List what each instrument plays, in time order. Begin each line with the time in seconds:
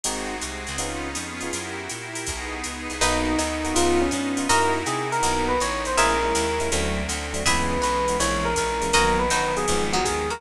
0.03 electric bass (finger) G#1, pad 5 (bowed) G#3 C4 D#4 F#4, electric piano 1 G#3 C4 D#4 F#4, ride
0.41 electric bass (finger) C2, pad 5 (bowed) G#3 C4 F#4 G#4, hi-hat pedal, ride
0.67 electric bass (finger) C#2, ride
0.78 pad 5 (bowed) B3 C#4 D#4 F4, electric piano 1 B3 C#4 D#4 F4, ride
1.15 electric bass (finger) F2, pad 5 (bowed) B3 C#4 F4 G#4, hi-hat pedal, ride
1.41 electric piano 1 B3 C#4 D#4 F4, ride
1.52 electric bass (finger) F#2, pad 5 (bowed) A#3 E4 F#4 G4, ride
1.89 electric bass (finger) A#2, pad 5 (bowed) A#3 E4 G4 A#4, hi-hat pedal, ride
2.15 ride
2.26 electric bass (finger) B1, pad 5 (bowed) B3 D#4 F#4 G#4, kick, ride
2.64 electric bass (finger) C#2, pad 5 (bowed) B3 D#4 G#4 B4, hi-hat pedal, ride
2.90 electric bass (finger) C2, ride
3.01 electric bass (finger) B1, electric piano 1 A#3 B3 D#4 F#4, pad 5 (bowed) A#3 B3 D#4 F#4, pizzicato strings D#4 B4, ride
3.38 electric bass (finger) D2, electric piano 1 D#4, hi-hat pedal, ride
3.64 electric piano 1 A#3 B3 D#4 F#4, ride
3.75 electric bass (finger) C#2, electric piano 1 B3 C#4 D#4 F4, pad 5 (bowed) B3 C#4 D#4 F4, ride
4.02 electric piano 1 C#4
4.11 electric bass (finger) G2, electric piano 1 C#4, hi-hat pedal, ride
4.37 electric piano 1 B3 C#4 D#4 F4, ride
4.49 electric bass (finger) F#2, electric piano 1 A#3 D#4 E4 F#4 A#4, pad 5 (bowed) A#3 D#4 E4 F#4, pizzicato strings F#4 D#5, ride
4.86 electric bass (finger) C3, electric piano 1 G#4, hi-hat pedal, ride
5.12 electric piano 1 A#4, ride
5.22 electric bass (finger) B1, electric piano 1 A#3 B3 D#4 F#4, pad 5 (bowed) A#3 B3 D#4 F#4, ride
5.48 electric piano 1 B4
5.60 electric bass (finger) A1, electric piano 1 C#5, hi-hat pedal, ride
5.85 electric piano 1 C5, ride
5.97 electric bass (finger) A#1, pad 5 (bowed) G#3 A#3 C#4 E4, electric piano 1 G#3 A#3 C#4 E4 A#4, pizzicato strings G#4 E5, ride
6.23 electric piano 1 G#3 A#3 C#4 E4
6.35 electric bass (finger) D#2, hi-hat pedal, ride
6.60 electric piano 1 G#3 A#3 C#4 E4, ride
6.71 electric bass (finger) D2, electric piano 1 F#3 A3 C4 D4, pad 5 (bowed) F#3 A3 C4 D4, ride
7.09 electric bass (finger) D2, hi-hat pedal, ride
7.33 electric piano 1 F#3 A3 C4 D4, ride
7.46 electric bass (finger) C#2, pad 5 (bowed) E3 G#3 B3 C#4, electric piano 1 E3 G#3 B3 C#4 B4, pizzicato strings G#4 E5, kick, ride
7.81 electric bass (finger) B1, electric piano 1 B4, hi-hat pedal, ride
8.08 electric piano 1 E3 G#3 B3 C#4, ride
8.19 electric bass (finger) A#1, pad 5 (bowed) E3 G#3 A#3 C#4, electric piano 1 E3 G#3 A#3 C#4 C#5, ride
8.45 electric piano 1 A#4
8.55 electric bass (finger) A#1, electric piano 1 A#4, kick, hi-hat pedal, ride
8.81 electric piano 1 E3 G#3 A#3 C#4, ride
8.93 electric bass (finger) B1, electric piano 1 D#3 F#3 A#3 B3 A#4, pad 5 (bowed) D#3 F#3 A#3 B3, pizzicato strings F#4 D#5, ride
9.19 electric piano 1 B4
9.30 electric bass (finger) G1, pizzicato strings F#3 D#4, electric piano 1 B4, hi-hat pedal, ride
9.56 electric piano 1 D#3 F#3 A#3 B3 G#4, ride
9.68 electric bass (finger) G#1, pad 5 (bowed) D#3 F3 G#3 B3, electric piano 1 D#3 F3 G#3 B3, kick, ride
9.93 pizzicato strings F#3 D#4, electric piano 1 F#4
10.04 electric bass (finger) D#2, electric piano 1 G#4, kick, hi-hat pedal, ride
10.30 pizzicato strings A#3 F#4, electric piano 1 A#4, ride